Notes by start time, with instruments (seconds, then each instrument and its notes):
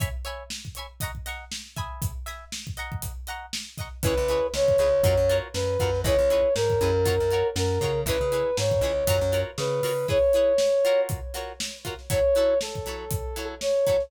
0.00 acoustic guitar (steel) C#5 E5 G#5 B5, kick, closed hi-hat
0.25 acoustic guitar (steel) C#5 E5 G#5 B5, closed hi-hat
0.50 snare
0.65 kick, snare
0.75 acoustic guitar (steel) C#5 E5 G#5, closed hi-hat
0.79 acoustic guitar (steel) B5
1.00 acoustic guitar (steel) D#5 F#5 A#5 C#6, kick, closed hi-hat
1.15 kick
1.26 acoustic guitar (steel) D#5 F#5 A#5 C#6, snare, closed hi-hat
1.52 snare
1.66 snare
1.76 acoustic guitar (steel) E5 G#5 B5 D#6, kick, closed hi-hat
2.02 kick, closed hi-hat
2.26 acoustic guitar (steel) E5 G#5 B5 D#6, snare, closed hi-hat
2.52 snare
2.67 kick
2.77 acoustic guitar (steel) D#5 F#5 A#5 C#6, closed hi-hat
2.92 kick
3.02 kick, closed hi-hat
3.27 acoustic guitar (steel) D#5 F#5 A#5 C#6, closed hi-hat
3.53 snare
3.66 snare
3.78 acoustic guitar (steel) D#5 F#5 A#5 C#6, kick, snare, closed hi-hat
4.03 electric bass (finger) C#2, acoustic guitar (steel) E4 G#4 B4 C#5, brass section B4, kick, closed hi-hat
4.17 electric bass (finger) C#2
4.28 acoustic guitar (steel) E4 G#4 B4 C#5, snare, closed hi-hat
4.54 electric bass (finger) C#2, brass section C#5, snare
4.68 kick
4.78 electric bass (finger) C#2, acoustic guitar (steel) E4 G#4 B4 C#5, closed hi-hat
5.03 electric bass (finger) F#2, acoustic guitar (steel) F4 F#4 A#4 C#5, kick, closed hi-hat
5.17 electric bass (finger) F#2
5.29 acoustic guitar (steel) F4 F#4 A#4 C#5, closed hi-hat
5.54 electric bass (finger) F#2, brass section B4, snare
5.80 electric bass (finger) F#2, acoustic guitar (steel) F4 F#4 A#4 C#5, kick, closed hi-hat
5.95 snare
6.04 electric bass (finger) C#2, acoustic guitar (steel) E4 G#4 B4 C#5, brass section C#5, kick, closed hi-hat
6.18 electric bass (finger) C#2
6.30 acoustic guitar (steel) E4 G#4 B4 C#5, closed hi-hat
6.55 electric bass (finger) G#2, brass section A#4, snare
6.70 kick
6.81 electric bass (finger) F#2, acoustic guitar (steel) E4 G#4 B4 C#5, closed hi-hat
7.05 acoustic guitar (steel) F4 F#4 A#4 C#5, kick, closed hi-hat
7.20 electric bass (finger) F#2
7.31 acoustic guitar (steel) F4 F#4 A#4 C#5, closed hi-hat
7.56 electric bass (finger) F#2, brass section A#4, snare
7.70 snare
7.81 electric bass (finger) C#3, acoustic guitar (steel) F4 F#4 A#4 C#5, kick, snare, closed hi-hat
8.06 electric bass (finger) C#2, acoustic guitar (steel) E4 G#4 B4 C#5, brass section B4, kick, closed hi-hat
8.21 electric bass (finger) C#3
8.32 acoustic guitar (steel) E4 G#4 B4 C#5, closed hi-hat
8.57 electric bass (finger) G#2, brass section C#5, snare
8.71 kick
8.81 electric bass (finger) C#2, acoustic guitar (steel) E4 G#4 B4 C#5, closed hi-hat
9.07 electric bass (finger) F#2, acoustic guitar (steel) F4 F#4 A#4 C#5, kick, closed hi-hat
9.21 electric bass (finger) F#2
9.32 acoustic guitar (steel) F4 F#4 A#4 C#5, closed hi-hat
9.58 electric bass (finger) C#3, brass section B4, snare
9.83 electric bass (finger) C#3, acoustic guitar (steel) F4 F#4 A#4 C#5, open hi-hat
10.08 acoustic guitar (steel) E4 G#4 B4 C#5, brass section C#5, kick
10.33 acoustic guitar (steel) E4 G#4 B4 C#5, closed hi-hat
10.58 snare
10.85 acoustic guitar (steel) F4 F#4 A#4 C#5, closed hi-hat
11.09 kick, closed hi-hat
11.34 acoustic guitar (steel) F4 F#4 A#4 C#5, snare, closed hi-hat
11.60 snare
11.74 snare
11.85 acoustic guitar (steel) F4 F#4 A#4 C#5, kick, closed hi-hat
11.99 snare
12.10 acoustic guitar (steel) F#3 E4 A4 C#5, brass section C#5, kick, closed hi-hat
12.35 acoustic guitar (steel) F#3 E4 A4 C#5, closed hi-hat
12.61 brass section A4, snare
12.75 kick
12.85 acoustic guitar (steel) F#3 E4 A4 C#5, snare, closed hi-hat
13.11 kick, closed hi-hat
13.36 acoustic guitar (steel) F#3 E4 A4 C#5, closed hi-hat
13.61 brass section C#5, snare
13.87 acoustic guitar (steel) F#3 E4 A4 C#5, kick, closed hi-hat
14.00 snare